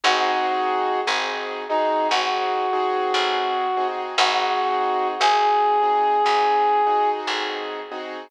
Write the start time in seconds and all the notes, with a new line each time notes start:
0.04 G#1 C4 D#4 F#4 G#4
1.07 G#1 C4 D#4 F#4 G#4
1.69 C4 D#4 F#4 G#4
2.09 G#1 C4 D#4 F#4 G#4
2.73 C4 D#4 F#4 G#4
3.14 A1
3.77 C4 D#4 F#4 G#4
4.17 G#1 C4 D#4 F#4 G#4
5.20 G#1 C4 D#4 F#4 G#4
5.82 C4 D#4 F#4 G#4
6.24 G#1 C4 D#4 F#4 G#4
6.87 C4 D#4 F#4 G#4
7.27 A1
7.91 C4 D#4 F#4 G#4